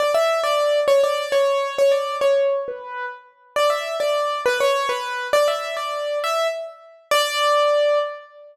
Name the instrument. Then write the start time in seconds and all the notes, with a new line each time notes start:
acoustic grand piano
0.00 D5
0.14 E5
0.43 D5
0.88 C#5
1.04 D5
1.32 C#5
1.78 C#5
1.92 D5
2.21 C#5
2.68 B4
3.56 D5
3.70 E5
4.00 D5
4.46 B4
4.60 C#5
4.89 B4
5.33 D5
5.48 E5
5.77 D5
6.24 E5
7.11 D5